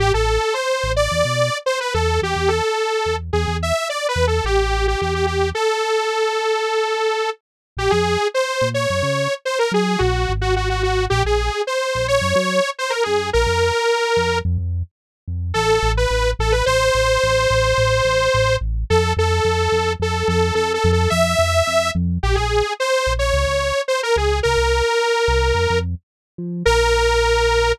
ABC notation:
X:1
M:4/4
L:1/16
Q:1/4=108
K:Am
V:1 name="Lead 2 (sawtooth)"
G A3 c3 d5 c B A2 | G2 A6 ^G2 e2 (3d2 B2 A2 | [M:2/4] G3 G G G G2 | [M:4/4] A14 z2 |
[K:Bbm] =G A3 c3 d5 c B A2 | [M:2/4] G3 G G G ^F2 | [M:4/4] =G A3 c3 d5 c B A2 | B8 z8 |
[M:2/4] [K:Am] A3 B3 A B | [M:4/4] c16 | A2 A6 A2 A2 (3A2 A2 A2 | [M:2/4] e6 z2 |
[M:4/4] [K:Bbm] =G A3 c3 d5 c B A2 | B12 z4 | [M:2/4] B8 |]
V:2 name="Synth Bass 1" clef=bass
A,,, A,,,5 A,,,2 E,, B,,5 E,,2 | E,, E,,5 E,,2 E,, E,,5 E,,2 | [M:2/4] A,,,4 E,,4 | [M:4/4] z16 |
[K:Bbm] B,,, F,,5 B,,2 G,, D,5 G,2 | [M:2/4] B,,,2 A,,,6 | [M:4/4] B,,, B,,,5 B,,,2 G,, G,5 G,,2 | B,,, F,,5 F,,2 F,, F,,5 F,,2 |
[M:2/4] [K:Am] A,,,2 A,,,2 A,,,2 A,,,2 | [M:4/4] A,,,2 A,,,2 A,,,2 A,,,2 A,,,2 A,,,2 A,,,2 A,,,2 | F,,2 F,,2 F,,2 F,,2 F,,2 F,,2 F,,2 F,,2 | [M:2/4] F,,2 F,,2 F,,2 F,,2 |
[M:4/4] [K:Bbm] B,,, B,,,5 B,,,2 D,, D,,5 D,,2 | C,, C,,5 C,,2 F,, F,,5 F,2 | [M:2/4] B,,,8 |]